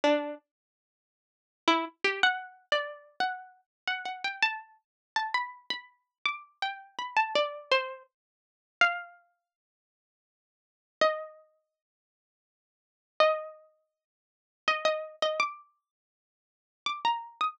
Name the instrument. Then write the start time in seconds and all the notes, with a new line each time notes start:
pizzicato strings
0.04 D4
1.68 E4
2.04 G4
2.23 F#5
2.72 D5
3.20 F#5
3.87 F#5
4.05 F#5
4.24 G5
4.42 A5
5.16 A5
5.34 B5
5.70 B5
6.25 D6
6.62 G5
6.99 B5
7.16 A5
7.35 D5
7.71 C5
8.81 F5
11.01 D#5
13.20 D#5
14.68 D#5
14.85 D#5
15.22 D#5
15.40 D6
16.86 D6
17.05 A#5
17.41 D#6